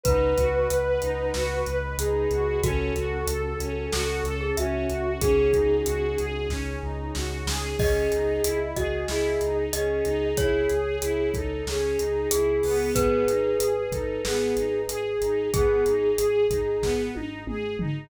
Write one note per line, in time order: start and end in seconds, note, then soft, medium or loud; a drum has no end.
0.03 0.33 C#2 loud
0.03 0.34 D#4 medium
0.03 1.80 B4 loud
0.03 0.99 B4 medium
0.03 1.33 D#5 medium
0.03 1.33 F#5 medium
0.03 1.33 B5 medium
0.03 kick loud
0.03 closed hi-hat loud
0.38 0.66 C#2 medium
0.38 0.67 F#4 medium
0.38 kick medium
0.38 closed hi-hat medium
0.69 0.98 C#2 medium
0.69 0.98 B4 medium
0.69 closed hi-hat medium
1.02 1.30 C#2 medium
1.02 1.31 D#4 medium
1.02 closed hi-hat medium
1.34 1.62 C#2 medium
1.34 1.63 F#4 medium
1.34 2.62 B4 medium
1.34 2.62 D#5 medium
1.34 2.62 B5 medium
1.34 snare loud
1.66 1.94 C#2 medium
1.66 1.96 B4 medium
1.66 closed hi-hat medium
1.98 2.26 C#2 medium
1.98 2.28 D#4 medium
1.98 2.60 G#4 medium
1.98 closed hi-hat loud
2.31 2.58 C#2 medium
2.31 2.60 F#4 medium
2.31 closed hi-hat medium
2.62 2.90 C#2 loud
2.62 3.91 C#4 medium
2.62 2.92 C#4 medium
2.62 3.91 F#4 medium
2.62 3.88 F#4 loud
2.62 4.37 A4 medium
2.62 3.91 A4 medium
2.62 kick loud
2.62 closed hi-hat medium
2.95 3.23 C#2 medium
2.95 3.25 F#4 medium
2.95 closed hi-hat medium
3.26 3.54 C#2 medium
3.26 3.57 A4 medium
3.26 closed hi-hat loud
3.60 3.87 C#2 medium
3.60 3.89 C#4 medium
3.60 closed hi-hat medium
3.92 4.21 C#2 medium
3.92 5.20 C#4 medium
3.92 4.22 F#4 medium
3.92 5.20 A4 medium
3.92 4.35 A4 medium
3.92 5.20 C#5 medium
3.92 snare loud
4.24 4.51 C#2 loud
4.24 4.54 A4 medium
4.24 closed hi-hat medium
4.41 4.56 G#4 medium
4.57 4.85 C#2 medium
4.57 4.86 C#4 medium
4.57 5.13 F#4 medium
4.57 5.13 E5 medium
4.57 closed hi-hat medium
4.89 5.17 C#2 medium
4.89 5.18 F#4 medium
4.89 closed hi-hat medium
5.21 5.49 C#2 loud
5.21 6.49 C#4 medium
5.21 5.50 C#4 medium
5.21 6.49 D#4 medium
5.21 6.49 F#4 medium
5.21 6.30 G#4 loud
5.21 6.49 G#4 medium
5.21 5.76 G#4 medium
5.21 kick loud
5.21 closed hi-hat loud
5.53 5.82 C#2 medium
5.53 5.82 D#4 medium
5.53 kick medium
5.53 closed hi-hat medium
5.86 6.15 C#2 medium
5.86 6.15 F#4 medium
5.86 closed hi-hat medium
6.18 6.46 C#2 medium
6.18 6.48 G#4 medium
6.18 closed hi-hat medium
6.49 6.77 C#2 medium
6.49 6.79 C#4 medium
6.49 7.79 C#4 medium
6.49 7.79 D#4 medium
6.49 7.79 G#4 medium
6.49 7.79 C#5 medium
6.49 kick medium
6.49 snare medium
6.82 7.10 C#2 medium
6.82 7.11 D#4 medium
7.15 7.43 C#2 medium
7.15 7.44 F#4 medium
7.15 snare loud
7.47 7.74 C#2 medium
7.47 7.76 G#4 medium
7.47 snare loud
7.78 8.06 C#2 medium
7.78 8.08 C#4 medium
7.78 8.59 G#4 loud
7.78 8.67 D#5 loud
7.78 kick loud
7.78 crash medium
8.11 8.39 C#2 medium
8.11 8.40 D#4 medium
8.11 closed hi-hat medium
8.44 8.72 C#2 medium
8.44 8.73 E4 medium
8.44 closed hi-hat loud
8.76 9.04 C#2 medium
8.76 9.07 F#4 medium
8.76 9.05 G#4 medium
8.76 9.54 D#5 medium
8.76 kick medium
8.76 closed hi-hat medium
9.08 9.36 C#2 medium
9.08 9.38 E4 medium
9.08 9.64 G#4 medium
9.08 snare loud
9.41 9.68 C#2 medium
9.41 9.70 D#4 medium
9.41 closed hi-hat medium
9.73 10.01 C#2 medium
9.73 10.02 C#4 medium
9.73 10.36 G#4 medium
9.73 10.25 D#5 medium
9.73 closed hi-hat loud
10.05 10.33 C#2 medium
10.05 10.34 D#4 medium
10.05 closed hi-hat medium
10.37 10.65 C#2 medium
10.37 10.67 E4 medium
10.37 11.30 G#4 loud
10.37 11.53 C#5 loud
10.37 kick loud
10.37 closed hi-hat medium
10.69 10.98 C#2 medium
10.69 10.99 G#4 medium
10.69 closed hi-hat medium
11.02 11.30 C#2 medium
11.02 11.31 E4 medium
11.02 closed hi-hat loud
11.33 11.61 C#2 medium
11.33 11.63 D#4 medium
11.33 11.65 A4 loud
11.33 kick medium
11.33 closed hi-hat medium
11.67 11.94 C#2 medium
11.67 11.96 C#4 medium
11.67 12.28 G#4 medium
11.67 snare loud
11.99 12.26 C#2 medium
11.99 12.28 D#4 medium
11.99 closed hi-hat medium
12.31 12.60 C#2 medium
12.31 12.60 E4 medium
12.31 12.86 G#4 medium
12.31 12.90 G#4 medium
12.31 closed hi-hat loud
12.63 12.91 C#2 medium
12.63 13.24 B3 medium
12.63 open hi-hat medium
12.95 13.24 G#1 medium
12.95 13.82 G#4 loud
12.95 15.12 B4 loud
12.95 kick loud
12.95 closed hi-hat loud
13.28 13.55 G#1 medium
13.28 13.57 D#4 medium
13.28 closed hi-hat medium
13.59 13.87 G#1 medium
13.59 13.89 G#4 medium
13.59 closed hi-hat loud
13.91 14.18 G#1 medium
13.91 14.22 D#4 medium
13.91 14.21 A4 medium
13.91 kick medium
13.91 closed hi-hat medium
14.25 14.52 G#1 medium
14.25 14.54 B3 medium
14.25 14.81 G#4 medium
14.25 snare loud
14.57 14.84 G#1 medium
14.57 14.86 D#4 medium
14.57 closed hi-hat medium
14.88 15.15 G#1 medium
14.88 15.18 G#4 medium
14.88 15.48 G#4 loud
14.88 closed hi-hat loud
15.21 15.49 G#1 medium
15.21 15.50 D#4 medium
15.21 closed hi-hat medium
15.53 15.82 G#1 medium
15.53 15.83 B3 medium
15.53 16.48 G#4 loud
15.53 17.00 G#4 loud
15.53 kick loud
15.53 closed hi-hat loud
15.85 16.13 G#1 medium
15.85 16.15 D#4 medium
15.85 closed hi-hat medium
16.18 16.46 G#1 medium
16.18 16.47 G#4 medium
16.18 closed hi-hat loud
16.50 16.77 G#1 medium
16.50 16.80 D#4 medium
16.50 kick medium
16.50 closed hi-hat medium
16.82 17.10 G#1 medium
16.82 17.11 B3 medium
16.82 kick medium
16.82 snare medium
17.15 17.43 G#1 medium
17.15 17.44 D#4 medium
17.15 high tom medium
17.47 17.74 G#1 medium
17.47 17.76 G#4 medium
17.47 mid tom loud
17.79 18.07 G#1 medium
17.79 18.09 D#4 medium
17.79 floor tom loud